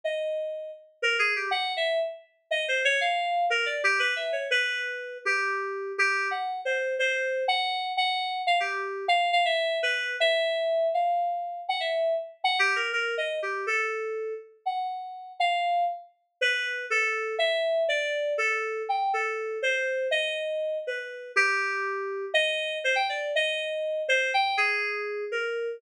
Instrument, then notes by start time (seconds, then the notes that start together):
electric piano 2
0.04 D#5
1.02 A#4
1.19 G#4
1.36 G4
1.51 F#5
1.77 E5
2.51 D#5
2.68 C5
2.85 C#5
3.01 F5
3.50 A#4
3.66 D5
3.84 G4
3.99 B4
4.16 E5
4.32 C#5
4.51 B4
5.25 G4
5.98 G4
6.31 F#5
6.65 C5
6.99 C5
7.48 F#5
7.97 F#5
8.47 F5
8.60 G4
9.08 F5
9.33 F5
9.45 E5
9.83 B4
10.20 E5
10.94 F5
11.68 F#5
11.80 E5
12.44 F#5
12.59 G4
12.76 A#4
12.93 A#4
13.18 D#5
13.42 G4
13.67 A4
14.66 F#5
15.40 F5
16.41 B4
16.90 A4
17.39 E5
17.89 D5
18.38 A4
18.89 G5
19.14 A4
19.62 C5
20.11 D#5
20.87 B4
21.36 G4
22.34 D#5
22.84 C5
22.96 G5
23.09 D5
23.35 D#5
24.08 C5
24.34 G5
24.57 G#4
25.32 A#4